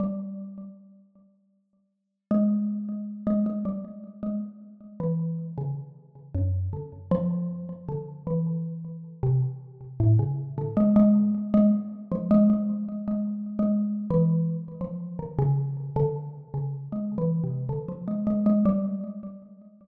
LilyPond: \new Staff { \clef bass \time 5/4 \tempo 4 = 78 g4 r2 gis4~ gis16 gis16 gis16 g16 | r8 gis16 r8. e8. cis16 r8. fis,8 d16 r16 f8. | r16 d8 e4~ e16 c16 r8. a,16 cis8 d16 gis16 gis8 r16 | gis16 r8 f16 gis16 gis8. \tuplet 3/2 { gis4 gis4 e4 } r16 f8 dis16 |
cis8. d8. cis8 \tuplet 3/2 { gis8 e8 c8 } d16 f16 gis16 gis16 gis16 g8 r16 | }